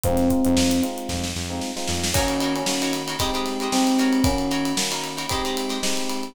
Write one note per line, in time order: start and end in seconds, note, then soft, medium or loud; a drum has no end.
0.04 0.29 F2 medium
0.04 0.25 G#3 medium
0.04 0.25 C4 medium
0.04 0.81 C4 loud
0.04 0.25 D#4 medium
0.04 0.25 F4 medium
0.04 kick medium
0.04 closed hi-hat medium
0.17 snare soft
0.17 closed hi-hat medium
0.30 0.42 G#3 medium
0.30 0.42 C4 medium
0.30 0.42 D#4 medium
0.30 0.42 F4 medium
0.30 kick medium
0.30 closed hi-hat medium
0.45 0.57 F2 medium
0.45 0.76 G#3 medium
0.45 0.76 C4 medium
0.45 0.76 D#4 medium
0.45 0.76 F4 medium
0.45 closed hi-hat medium
0.57 0.81 F2 medium
0.57 snare medium
0.71 closed hi-hat medium
0.83 1.26 G#3 medium
0.83 1.26 C4 medium
0.83 1.26 D#4 medium
0.83 1.26 F4 medium
0.83 closed hi-hat medium
0.98 closed hi-hat soft
1.09 1.33 F2 medium
1.09 kick medium
1.09 snare medium
1.24 snare medium
1.36 1.60 F2 medium
1.36 snare medium
1.50 1.71 G#3 medium
1.50 1.71 C4 medium
1.50 1.71 D#4 medium
1.50 1.71 F4 medium
1.61 snare medium
1.76 2.07 G#3 medium
1.76 2.07 C4 medium
1.76 2.07 D#4 medium
1.76 2.07 F4 medium
1.76 snare medium
1.88 2.13 F2 medium
1.88 snare medium
2.04 snare medium
2.14 2.62 D#3 medium
2.14 2.62 A#3 medium
2.14 2.62 C#4 medium
2.14 2.54 C#4 medium
2.14 2.36 D#4 medium
2.14 2.62 F#4 medium
2.14 2.36 F#4 medium
2.14 2.36 A#4 medium
2.14 2.36 C#5 medium
2.14 kick medium
2.14 crash medium
2.28 ride medium
2.40 2.73 D#4 medium
2.40 2.73 F#4 medium
2.40 2.73 A#4 medium
2.40 2.73 C#5 medium
2.40 ride medium
2.56 2.92 C#4 medium
2.56 ride medium
2.66 3.15 D#3 medium
2.66 3.15 A#3 medium
2.66 3.15 C#4 medium
2.66 3.15 F#4 medium
2.66 snare medium
2.82 3.03 D#4 medium
2.82 3.03 F#4 medium
2.82 3.03 A#4 medium
2.82 3.03 C#5 medium
2.82 ride medium
2.93 snare soft
2.93 ride medium
3.07 3.17 D#4 medium
3.07 3.17 F#4 medium
3.07 3.17 A#4 medium
3.07 3.17 C#5 medium
3.07 ride medium
3.19 3.31 G#3 medium
3.19 3.68 G#3 medium
3.19 3.68 C4 medium
3.19 3.68 D#4 medium
3.19 3.31 G4 medium
3.19 3.68 G4 medium
3.19 3.31 C5 medium
3.19 3.31 D#5 medium
3.19 kick medium
3.19 ride medium
3.34 3.54 G#3 medium
3.34 3.54 G4 medium
3.34 3.54 C5 medium
3.34 3.54 D#5 medium
3.34 ride soft
3.46 snare soft
3.46 ride medium
3.60 3.97 G#3 medium
3.60 3.97 G4 medium
3.60 3.97 C5 medium
3.60 3.97 D#5 medium
3.60 ride soft
3.72 4.20 G#3 medium
3.72 4.20 C4 medium
3.72 4.24 C4 medium
3.72 4.20 D#4 medium
3.72 4.20 G4 medium
3.72 snare medium
3.87 ride medium
3.98 4.46 D#4 medium
3.98 4.46 F#4 medium
3.98 4.46 A#4 medium
3.98 4.46 C#5 medium
3.98 ride medium
4.13 ride medium
4.24 4.73 D#3 medium
4.24 4.73 A#3 medium
4.24 4.73 C#4 medium
4.24 4.72 C#4 loud
4.24 4.73 F#4 medium
4.24 kick medium
4.24 ride medium
4.38 ride soft
4.51 4.83 D#4 medium
4.51 4.83 F#4 medium
4.51 4.83 A#4 medium
4.51 4.83 C#5 medium
4.51 ride medium
4.65 ride medium
4.77 5.25 D#3 medium
4.77 5.25 A#3 medium
4.77 5.25 C#4 medium
4.77 5.25 F#4 medium
4.77 snare medium
4.91 5.11 D#4 medium
4.91 5.11 F#4 medium
4.91 5.11 A#4 medium
4.91 5.11 C#5 medium
4.91 ride medium
5.04 ride medium
5.17 5.27 D#4 medium
5.17 5.27 F#4 medium
5.17 5.27 A#4 medium
5.17 5.27 C#5 medium
5.17 ride medium
5.29 5.78 G#3 medium
5.29 5.43 G#3 medium
5.29 5.78 C4 medium
5.29 5.78 D#4 medium
5.29 5.78 G4 medium
5.29 5.43 G4 medium
5.29 5.43 C5 medium
5.29 5.43 D#5 medium
5.29 kick medium
5.29 ride medium
5.45 5.66 G#3 medium
5.45 5.66 G4 medium
5.45 5.66 C5 medium
5.45 5.66 D#5 medium
5.45 ride medium
5.57 ride medium
5.69 6.10 G#3 medium
5.69 6.10 G4 medium
5.69 6.10 C5 medium
5.69 6.10 D#5 medium
5.69 snare soft
5.69 ride soft
5.83 6.31 G#3 medium
5.83 6.31 C4 medium
5.83 6.31 D#4 medium
5.83 6.31 G4 medium
5.83 snare medium
5.97 ride soft
6.10 ride medium
6.23 ride soft